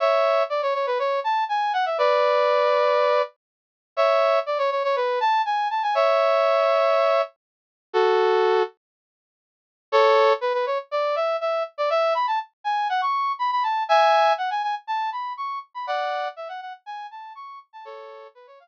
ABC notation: X:1
M:4/4
L:1/16
Q:1/4=121
K:A
V:1 name="Brass Section"
[ce]4 d c c B c2 a2 g2 f e | [Bd]12 z4 | [ce]4 d c c c B2 a2 g2 a g | [ce]12 z4 |
[FA]6 z10 | [K:F#m] [Ac]4 B B c z d2 e2 e2 z d | e2 b a z2 g2 f c'3 b b a2 | [eg]4 f g g z a2 b2 c'2 z b |
[df]4 e f f z g2 a2 c'2 z a | [Ac]4 B c ^e z9 |]